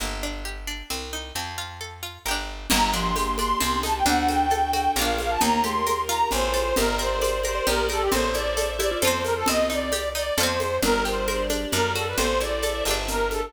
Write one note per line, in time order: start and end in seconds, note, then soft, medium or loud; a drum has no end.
0.00 0.83 G1 medium
0.00 0.20 A#3 medium
0.23 0.43 D4 medium
0.45 0.65 G4 medium
0.67 0.88 D4 medium
0.90 1.32 C2 medium
0.90 1.10 C4 medium
1.13 1.33 D#4 medium
1.35 2.18 F2 medium
1.35 1.56 C4 medium
1.58 1.78 F4 medium
1.81 2.01 A4 medium
2.03 2.23 F4 medium
2.26 2.67 G1 medium
2.26 2.66 G4 medium
2.26 2.66 A#4 medium
2.31 2.66 D4 medium
2.70 3.54 G1 loud
2.70 2.93 G3 loud
2.70 3.56 A#3 loud
2.70 3.60 A#3 medium
2.70 3.60 D4 medium
2.70 3.60 G4 medium
2.70 2.90 A#5 medium
2.70 crash loud
2.70 low conga loud
2.70 shaker medium
2.92 3.12 F3 medium
2.92 3.38 D4 medium
2.92 3.35 C6 medium
2.92 shaker medium
3.16 3.59 G4 medium
3.16 high conga medium
3.16 shaker medium
3.38 3.60 D4 medium
3.38 3.58 C6 medium
3.38 high conga medium
3.38 shaker medium
3.60 4.03 C2 loud
3.60 4.03 C4 loud
3.60 4.05 C4 medium
3.60 4.05 D#4 medium
3.60 4.05 G4 medium
3.60 3.79 C6 medium
3.60 low conga medium
3.60 shaker medium
3.83 4.05 D#4 medium
3.83 3.95 A5 medium
3.83 high conga medium
3.83 shaker medium
3.96 4.07 G5 medium
4.06 4.89 D2 loud
4.06 4.46 D4 loud
4.06 4.91 D4 loud
4.06 4.95 D4 medium
4.06 4.96 F#4 medium
4.06 4.96 A4 medium
4.06 4.28 F#5 medium
4.06 low conga medium
4.06 shaker medium
4.28 4.73 F#4 medium
4.28 4.71 G5 medium
4.28 high conga medium
4.28 shaker medium
4.50 4.94 A4 medium
4.50 high conga medium
4.50 shaker medium
4.73 4.95 F#4 medium
4.73 4.91 G5 medium
4.73 high conga medium
4.73 shaker medium
4.96 5.37 A#1 loud
4.96 5.40 D4 medium
4.96 5.40 F4 medium
4.96 5.37 F4 loud
4.96 5.40 A#4 loud
4.96 5.37 A#4 loud
4.96 5.19 F5 medium
4.96 low conga medium
4.96 shaker medium
5.02 5.37 D4 loud
5.18 5.31 F5 medium
5.18 high conga medium
5.18 shaker medium
5.30 5.40 A5 medium
5.41 6.24 D#2 loud
5.41 5.61 A#3 loud
5.41 6.30 D#4 medium
5.41 5.61 D#4 loud
5.41 6.30 G4 medium
5.41 6.30 A#4 medium
5.41 5.64 A#5 medium
5.41 low conga medium
5.41 shaker medium
5.64 5.83 A3 medium
5.64 5.84 G4 medium
5.64 6.01 C6 medium
5.64 high conga medium
5.64 shaker medium
5.86 6.07 A#4 medium
5.86 high conga medium
5.86 shaker medium
6.09 6.52 F4 loud
6.09 6.28 A#5 medium
6.09 shaker medium
6.31 6.73 A1 loud
6.31 6.75 F4 medium
6.31 6.75 A4 loud
6.31 6.75 C5 medium
6.31 6.76 C5 medium
6.31 low conga medium
6.31 shaker medium
6.54 6.74 A4 medium
6.54 high conga medium
6.54 shaker medium
6.76 7.60 G1 loud
6.76 7.65 G4 medium
6.76 6.97 G4 loud
6.76 7.65 A#4 medium
6.76 6.96 A#4 medium
6.76 6.96 A#4 loud
6.76 7.65 D5 medium
6.76 low conga medium
6.76 shaker medium
6.98 7.19 A#4 medium
6.98 7.40 C5 medium
6.98 shaker medium
7.21 7.42 D5 medium
7.21 high conga medium
7.21 shaker medium
7.44 7.65 A#4 medium
7.44 7.56 C5 medium
7.44 7.67 C5 medium
7.44 high conga medium
7.44 shaker medium
7.55 7.66 D5 medium
7.66 8.09 A#1 loud
7.66 8.11 G4 medium
7.66 7.87 G4 loud
7.66 7.89 G4 medium
7.66 7.85 A#4 medium
7.66 8.11 A#4 medium
7.66 8.11 D5 medium
7.66 low conga medium
7.66 shaker medium
7.89 8.09 G4 medium
7.89 8.02 A4 medium
7.89 8.10 A#4 medium
7.89 high conga medium
7.89 shaker medium
8.02 8.12 G4 medium
8.11 8.95 A1 loud
8.11 8.98 C4 loud
8.11 8.32 A4 medium
8.11 9.01 A4 medium
8.11 8.31 C5 medium
8.11 9.01 C5 medium
8.11 9.03 E5 medium
8.11 low conga loud
8.11 shaker medium
8.34 8.79 E4 medium
8.34 8.70 D5 medium
8.34 high conga medium
8.34 shaker medium
8.57 9.00 A4 medium
8.57 high conga medium
8.57 shaker medium
8.79 9.01 E4 medium
8.79 8.90 G4 medium
8.79 8.97 D5 medium
8.79 high conga medium
8.79 shaker medium
8.91 9.02 F4 medium
9.01 9.44 F2 loud
9.01 9.47 F4 medium
9.01 9.43 F4 loud
9.01 9.47 A4 medium
9.01 9.43 A4 loud
9.01 9.23 C5 medium
9.01 9.47 C5 medium
9.01 9.24 C5 medium
9.01 low conga medium
9.01 shaker medium
9.07 9.43 C4 loud
9.23 9.34 A#4 medium
9.23 9.46 C5 medium
9.23 high conga medium
9.23 shaker medium
9.36 9.47 A4 medium
9.46 10.31 C2 medium
9.46 9.90 C4 medium
9.46 10.33 C4 loud
9.46 9.66 D#5 loud
9.46 low conga medium
9.46 shaker medium
9.70 10.14 D#4 medium
9.70 10.09 D5 medium
9.70 shaker medium
9.92 10.35 G4 loud
9.92 high conga medium
9.92 shaker medium
10.15 10.36 D#4 medium
10.15 10.37 D5 medium
10.15 shaker medium
10.37 10.79 F2 loud
10.37 10.78 F4 loud
10.37 10.78 A4 loud
10.37 10.77 C5 medium
10.37 low conga medium
10.37 shaker medium
10.43 10.78 C4 loud
10.60 high conga medium
10.60 shaker medium
10.82 11.66 G1 loud
10.82 11.66 G3 medium
10.82 11.03 D4 loud
10.82 11.26 G4 medium
10.82 11.26 A#4 medium
10.82 11.03 A#4 medium
10.82 11.26 D5 medium
10.82 low conga loud
10.82 shaker medium
11.05 11.25 G4 medium
11.05 11.44 C5 medium
11.05 shaker medium
11.28 11.72 D4 medium
11.28 11.72 G4 medium
11.28 11.48 A#4 medium
11.28 11.72 D5 medium
11.28 high conga medium
11.28 shaker medium
11.50 11.70 D4 medium
11.50 high conga medium
11.50 shaker medium
11.72 12.14 F#2 loud
11.72 11.93 D4 loud
11.72 12.19 F#4 medium
11.72 12.16 A4 medium
11.72 11.91 A#4 medium
11.72 12.19 D5 medium
11.72 low conga medium
11.72 shaker medium
11.95 12.16 F#4 medium
11.95 12.06 A4 medium
11.95 high conga medium
11.95 shaker medium
12.07 12.18 B4 medium
12.17 12.82 A1 medium
12.17 12.38 C4 loud
12.17 12.61 E4 medium
12.17 12.61 A4 loud
12.17 12.94 A4 medium
12.17 12.61 C5 medium
12.17 12.39 C5 medium
12.17 low conga medium
12.17 shaker medium
12.40 12.61 E4 medium
12.40 12.84 D5 medium
12.40 high conga medium
12.40 shaker medium
12.62 13.07 E4 medium
12.62 12.84 A4 medium
12.62 13.07 C5 medium
12.62 13.07 E5 medium
12.62 high conga medium
12.62 shaker medium
12.85 13.50 G1 loud
12.85 13.48 G4 medium
12.85 13.48 A#4 medium
12.85 high conga medium
12.85 shaker medium
12.91 13.48 D4 loud
13.08 13.53 D4 medium
13.08 13.53 G4 medium
13.08 13.29 A#4 medium
13.08 13.53 A#4 medium
13.08 low conga medium
13.08 shaker medium
13.31 13.43 A4 medium
13.31 high conga medium
13.31 shaker medium
13.43 13.53 A4 medium